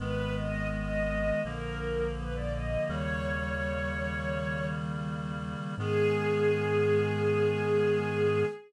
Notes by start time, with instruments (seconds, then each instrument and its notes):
0.00 synth bass 1 G#1, clarinet D#3 G#3 B3, string ensemble 1 B4
0.36 string ensemble 1 D#5
0.72 string ensemble 1 D#5
1.44 synth bass 1 A#1, clarinet D3 F3 A#3, string ensemble 1 A#4
2.17 string ensemble 1 B4
2.35 string ensemble 1 D5
2.53 string ensemble 1 D#5
2.89 synth bass 1 D#2, clarinet C#3 D#3 G3 A#3, string ensemble 1 C#5
5.78 synth bass 1 G#2, clarinet D#3 G#3 B3, string ensemble 1 G#4